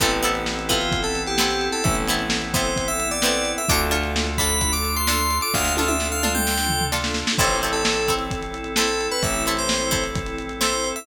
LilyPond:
<<
  \new Staff \with { instrumentName = "Electric Piano 2" } { \time 4/4 \key a \minor \tempo 4 = 130 a'16 r4 r16 f'8. a'8 g'4 a'16 | e''16 r4 r16 c''8. e''8 d''4 e''16 | d'''16 r4 r16 b''8. d'''8 c'''4 d'''16 | f''8 f''16 e''8 f''8 g''4~ g''16 r4 |
c''8 r16 a'4 r4 r16 a'8. b'16 | e''8 r16 c''4 r4 r16 c''8. e''16 | }
  \new Staff \with { instrumentName = "Drawbar Organ" } { \time 4/4 \key a \minor <b c' e' a'>1~ | <b c' e' a'>1 | <d' f' a'>1~ | <d' f' a'>1 |
<c' e' a'>1~ | <c' e' a'>1 | }
  \new Staff \with { instrumentName = "Pizzicato Strings" } { \time 4/4 \key a \minor <b c' e' a'>8 <b c' e' a'>4 <b c' e' a'>4. <b c' e' a'>4~ | <b c' e' a'>8 <b c' e' a'>4 <b c' e' a'>4. <b c' e' a'>4 | <d' f' a'>8 <d' f' a'>4 <d' f' a'>4. <d' f' a'>4~ | <d' f' a'>8 <d' f' a'>4 <d' f' a'>4. <d' f' a'>4 |
<c' e' a'>8 <c' e' a'>4 <c' e' a'>4. <c' e' a'>4~ | <c' e' a'>8 <c' e' a'>4 <c' e' a'>4. <c' e' a'>4 | }
  \new Staff \with { instrumentName = "Electric Bass (finger)" } { \clef bass \time 4/4 \key a \minor a,,1 | a,,1 | d,1 | d,1 |
a,,1 | a,,1 | }
  \new Staff \with { instrumentName = "Pad 2 (warm)" } { \time 4/4 \key a \minor <b c' e' a'>1~ | <b c' e' a'>1 | <d' f' a'>1~ | <d' f' a'>1 |
<c' e' a'>1~ | <c' e' a'>1 | }
  \new DrumStaff \with { instrumentName = "Drums" } \drummode { \time 4/4 <hh bd>16 hh16 hh16 hh16 sn16 hh16 <hh bd>16 hh16 <hh bd>16 hh16 hh16 hh16 sn16 hh16 hh16 hh16 | <hh bd>16 hh16 hh16 hh16 sn16 hh16 <hh bd>16 hh16 <hh bd>16 hh16 hh16 hh16 sn16 hh16 hh16 hh16 | <hh bd>16 hh16 hh16 hh16 sn16 hh16 <hh bd>16 hh16 <hh bd>16 hh16 hh16 hh16 sn16 hh16 hh16 hh16 | <bd sn>16 sn16 tommh16 tommh16 sn8 toml16 toml16 sn16 sn16 tomfh16 tomfh16 sn16 sn16 sn16 sn16 |
<cymc bd>16 hh16 hh16 hh16 sn16 hh16 <hh bd>16 hh16 <hh bd>16 hh16 hh16 hh16 sn16 hh16 hh16 hh16 | <hh bd>16 hh16 hh16 hh16 sn16 hh16 <hh bd>16 hh16 <hh bd>16 hh16 hh16 hh16 sn16 hh16 hh16 hh16 | }
>>